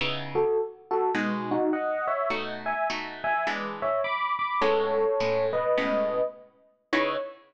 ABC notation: X:1
M:4/4
L:1/8
Q:"Swing" 1/4=104
K:C#m
V:1 name="Electric Piano 1"
z [FA] z [FA] z [DF] [df] [ce] | z [eg] z [eg] z [ce] [b=d'] [bd'] | [Ac]3 [Bd]3 z2 | c2 z6 |]
V:2 name="Acoustic Guitar (steel)"
[C,B,DE]4 [B,,G,DF]4 | [B,,A,DF]2 [B,,A,DF]2 [E,G,B,=D]4 | [A,,G,B,C]2 [A,,G,B,C]2 [A,,G,B,C]4 | [C,B,DE]2 z6 |]